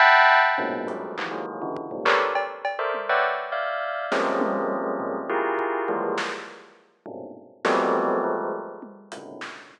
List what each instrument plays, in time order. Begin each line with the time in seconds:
0.00 tubular bells E5 F#5 G5 A5 B5, floor tom
0.58 tubular bells F#2 G#2 A#2 B2
0.87 tubular bells F3 F#3 G3 G#3 A3, closed hi-hat
1.18 tubular bells D#3 E3 F3, clap
1.31 tubular bells D#3 E3 F#3 G#3 A#3
1.62 tubular bells C#3 D3 E3
1.76 kick
1.91 tubular bells F2 G2 G#2 A#2 C3
2.05 tubular bells G4 A4 A#4 B4 C#5 D5, clap
2.35 cowbell
2.65 cowbell
2.79 tubular bells A4 A#4 C5 D5 E5
2.94 high tom
3.09 tubular bells B4 C#5 D5 E5 F#5 G5
3.52 tubular bells D5 E5 F5
4.12 tubular bells F3 G3 G#3 A#3 C4 C#4, snare
4.41 high tom
5.00 floor tom
5.30 tubular bells E4 F4 G4 G#4 A#4
5.59 kick
5.88 tubular bells E3 F3 G3 G#3 A#3, kick
6.18 snare
7.06 tubular bells G2 G#2 A#2 B2 C3, floor tom
7.65 tubular bells F3 F#3 G3 A3 B3 C4, snare
8.24 tubular bells F3 G3 G#3 A3
8.82 high tom
9.12 tubular bells G#2 A2 B2 C#3 D3, closed hi-hat
9.41 snare
9.71 kick